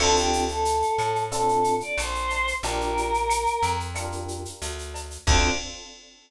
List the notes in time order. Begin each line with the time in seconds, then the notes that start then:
0.00 D2 C4 D4 F4 A4, crash, cowbell, claves
0.16 G4, shaker
0.33 shaker
0.48 A4, shaker
0.65 shaker
0.82 shaker
0.98 A2, claves, shaker
1.15 shaker
1.31 C4 D4 F4 A4, cowbell, shaker
1.48 shaker
1.64 shaker
1.80 D5, shaker
1.98 A#1 C5, cowbell, claves, shaker
2.15 shaker
2.30 cowbell, shaker
2.47 shaker
2.63 A#1 D4 F4 G4 A#4, cowbell, shaker
2.81 shaker
2.97 shaker
3.14 shaker
3.30 claves, shaker
3.46 shaker
3.63 F2, shaker
3.80 shaker
3.95 D4 F4 G4 A#4, cowbell, claves, shaker
4.12 shaker
4.28 shaker
4.45 shaker
4.61 D2, cowbell, shaker
4.78 shaker
4.94 cowbell, shaker
5.11 shaker
5.27 D2 C4 D4 F4 A4 D5, kick, crash